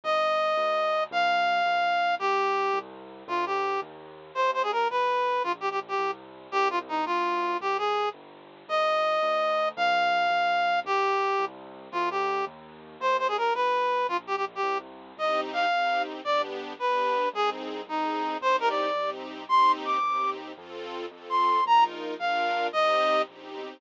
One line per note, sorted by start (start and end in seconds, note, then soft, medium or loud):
0.04 0.53 G1 loud
0.04 1.04 D#5 medium
0.57 1.07 D2 loud
1.11 1.61 C2 loud
1.11 2.15 F5 loud
1.66 2.16 C2 loud
2.19 2.69 D#2 medium
2.19 2.79 G4 loud
2.74 3.23 C2 loud
3.28 3.78 D2 loud
3.28 3.45 F4 medium
3.46 3.80 G4 medium
3.82 4.31 D#2 loud
4.35 4.85 D#2 loud
4.35 4.51 C5 medium
4.54 4.62 C5 medium
4.63 4.71 G#4 medium
4.72 4.88 A#4 medium
4.90 5.39 G1 loud
4.90 5.43 B4 medium
5.44 5.94 A#1 loud
5.44 5.52 F4 medium
5.61 5.69 G4 medium
5.71 5.80 G4 medium
5.88 6.11 G4 medium
5.98 6.48 C2 loud
6.52 7.02 C2 loud
6.52 6.68 G4 loud
6.70 6.79 F4 medium
6.89 7.05 D#4 medium
7.06 7.55 D2 loud
7.06 7.57 F4 medium
7.60 8.10 C2 medium
7.60 7.77 G4 medium
7.78 8.09 G#4 medium
8.14 8.64 G1 loud
8.68 9.18 G1 loud
8.68 9.69 D#5 medium
9.22 9.72 D2 loud
9.77 10.27 C2 loud
9.77 10.80 F5 loud
10.30 10.80 C2 loud
10.85 11.34 D#2 medium
10.85 11.45 G4 loud
11.39 11.89 C2 loud
11.92 12.42 D2 loud
11.92 12.09 F4 medium
12.11 12.45 G4 medium
12.47 12.96 D#2 loud
13.00 13.50 D#2 loud
13.00 13.17 C5 medium
13.19 13.27 C5 medium
13.28 13.37 G#4 medium
13.37 13.53 A#4 medium
13.55 14.05 G1 loud
13.55 14.07 B4 medium
14.09 14.59 A#1 loud
14.09 14.17 F4 medium
14.27 14.36 G4 medium
14.36 14.45 G4 medium
14.55 14.78 G4 medium
14.63 15.13 C2 loud
15.17 15.67 C2 medium
15.17 15.66 C4 medium
15.17 15.66 D#4 loud
15.17 15.66 G4 medium
15.17 15.41 D#5 medium
15.53 16.02 F5 medium
15.71 16.21 C2 medium
15.71 16.21 C4 medium
15.71 16.21 D#4 medium
15.71 16.21 G4 medium
16.25 16.75 G1 medium
16.25 16.73 B3 medium
16.25 16.73 D4 medium
16.25 16.73 G4 medium
16.25 16.42 D5 medium
16.79 17.29 G1 medium
16.79 17.27 B3 medium
16.79 17.27 D4 medium
16.79 17.27 G4 medium
16.79 17.29 B4 medium
17.33 17.83 C2 loud
17.33 17.81 C4 loud
17.33 17.81 D#4 medium
17.33 17.81 G#4 medium
17.33 17.50 G#4 loud
17.87 18.37 C2 medium
17.87 18.36 C4 medium
17.87 18.36 D#4 medium
17.87 18.37 D#4 medium
17.87 18.36 G#4 medium
18.41 18.91 C2 loud
18.41 18.90 C4 medium
18.41 18.90 D#4 loud
18.41 18.90 G4 medium
18.41 18.56 C5 loud
18.60 18.69 A#4 medium
18.69 19.10 D5 medium
18.95 19.45 C2 medium
18.95 19.44 C4 medium
18.95 19.44 D#4 medium
18.95 19.44 G4 medium
19.49 19.99 D#2 medium
19.49 19.98 C4 medium
19.49 19.98 D#4 loud
19.49 19.98 G4 loud
19.49 19.72 C6 loud
19.85 20.30 D6 medium
20.03 20.53 D#2 medium
20.03 20.52 C4 medium
20.03 20.52 D#4 medium
20.03 20.52 G4 medium
20.57 21.07 F2 medium
20.57 21.06 C4 medium
20.57 21.06 F4 loud
20.57 21.06 A4 medium
21.11 21.61 F2 medium
21.11 21.60 C4 medium
21.11 21.60 F4 medium
21.11 21.60 A4 medium
21.30 21.64 C6 medium
21.66 22.15 A#1 medium
21.66 22.15 D#4 loud
21.66 22.15 F4 medium
21.66 22.15 A#4 medium
21.66 21.84 A#5 loud
22.19 22.69 A#1 medium
22.19 22.68 D4 medium
22.19 22.68 F4 loud
22.19 22.68 A#4 medium
22.19 22.67 F5 medium
22.73 23.24 C2 medium
22.73 23.22 C4 loud
22.73 23.22 D#4 medium
22.73 23.22 G4 loud
22.73 23.22 D#5 loud
23.28 23.52 A#1 medium
23.28 23.77 C4 medium
23.28 23.77 D#4 medium
23.28 23.77 G4 medium
23.55 23.79 B1 medium